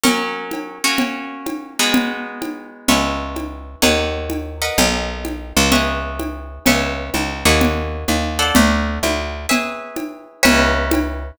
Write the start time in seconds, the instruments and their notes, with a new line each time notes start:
0.04 acoustic guitar (steel) F#3 C#4 A#4, cowbell, low conga
0.51 cowbell, high conga
0.84 acoustic guitar (steel) A#3 C#4 F#4
0.98 cowbell, low conga
1.46 cowbell, high conga
1.79 acoustic guitar (steel) G#3 B3 D#4 F#4
1.93 cowbell, low conga
2.42 cowbell, high conga
2.88 electric bass (finger) C#2, acoustic guitar (steel) B4 C#5 E5 G#5, cowbell, low conga
3.36 cowbell, high conga
3.82 electric bass (finger) D#2, acoustic guitar (steel) A#4 C#5 D#5 F#5, cowbell, low conga
4.30 cowbell, high conga
4.62 acoustic guitar (steel) A#4 B4 D#5 F#5
4.78 electric bass (finger) B1, cowbell, low conga
5.25 cowbell, high conga
5.57 electric bass (finger) C#2
5.72 acoustic guitar (steel) G#4 B4 C#5 E5, cowbell, low conga
6.19 cowbell, high conga
6.66 electric bass (finger) C#2, acoustic guitar (steel) B4 C#5 E5 G#5, cowbell, low conga
7.14 electric bass (finger) C#2, cowbell, high conga
7.45 electric bass (finger) D#2, acoustic guitar (steel) A#4 C#5 D#5 F#5
7.60 cowbell, low conga
8.08 electric bass (finger) D#2, cowbell, high conga
8.39 acoustic guitar (steel) A4 C5 D5 F#5
8.55 electric bass (finger) D2, cowbell, low conga
9.03 electric bass (finger) D2, cowbell, high conga
9.49 acoustic guitar (steel) G#4 B4 C#5 E5, cowbell, low conga
9.96 cowbell, high conga
10.43 electric bass (finger) C#2, acoustic guitar (steel) B4 C#5 E5 G#5, cowbell, low conga
10.91 cowbell, high conga